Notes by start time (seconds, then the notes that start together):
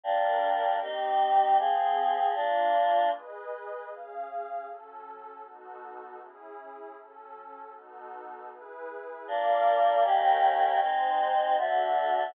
0.03 G3 A#3 D4 A#4
0.81 C4 D#4 G4
1.58 F3 C4 G#4
2.34 A#3 D4 F4
3.12 G#4 B4 D#5
3.89 C#4 G#4 F5
4.66 F#3 C#4 A4
5.43 B3 D#4 F#4 A4
6.20 C#4 E4 G#4
6.96 F#3 C#4 A4
7.73 B3 D#4 F#4 A4
8.50 E4 G#4 B4
9.27 A#3 D4 F4 A#4 D5 F5
10.04 D#3 A#3 C#4 D#4 G4 A#4 C#5 G5
10.81 G#3 C4 D#4 C5
11.58 D3 A3 D4 F#4 A4